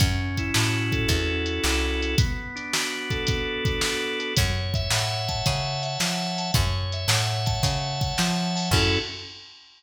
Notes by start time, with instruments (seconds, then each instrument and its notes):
0.00 electric bass (finger) F#2, drawbar organ C#4, kick, closed hi-hat
0.37 drawbar organ E4, kick, closed hi-hat
0.54 electric bass (finger) A2, drawbar organ F#4, snare
0.92 drawbar organ A4, kick, closed hi-hat
1.08 electric bass (finger) E2, drawbar organ C#4, kick, closed hi-hat
1.46 drawbar organ E4, closed hi-hat
1.64 electric bass (finger) C2, drawbar organ F#4, snare
2.02 drawbar organ A4, closed hi-hat
2.18 drawbar organ B3, kick, closed hi-hat
2.56 drawbar organ D4, closed hi-hat
2.73 drawbar organ F#4, snare
3.10 drawbar organ A4, kick, closed hi-hat
3.27 drawbar organ B3, kick, closed hi-hat
3.64 drawbar organ D4, kick, closed hi-hat
3.81 drawbar organ F#4, snare
4.19 drawbar organ A4, closed hi-hat
4.36 electric bass (finger) F#2, drawbar organ C#5, kick, closed hi-hat
4.74 drawbar organ E5, kick, closed hi-hat
4.90 electric bass (finger) A2, drawbar organ F#5, snare
5.28 drawbar organ A5, kick, closed hi-hat
5.45 electric bass (finger) C#3, drawbar organ C#5, kick, closed hi-hat
5.83 drawbar organ E5, closed hi-hat
5.99 electric bass (finger) F3, drawbar organ F#5, snare
6.38 drawbar organ A5, closed hi-hat
6.54 electric bass (finger) F#2, drawbar organ C#5, kick, closed hi-hat
6.92 drawbar organ E5, closed hi-hat
7.08 electric bass (finger) A2, drawbar organ F#5, snare
7.46 drawbar organ A5, kick, closed hi-hat
7.63 electric bass (finger) C#3, drawbar organ C#5, kick, closed hi-hat
8.01 drawbar organ E5, kick, closed hi-hat
8.18 electric bass (finger) F3, drawbar organ F#5, snare
8.55 drawbar organ A5, open hi-hat
8.71 electric bass (finger) F#2, drawbar organ C#4 E4 F#4 A4, kick, crash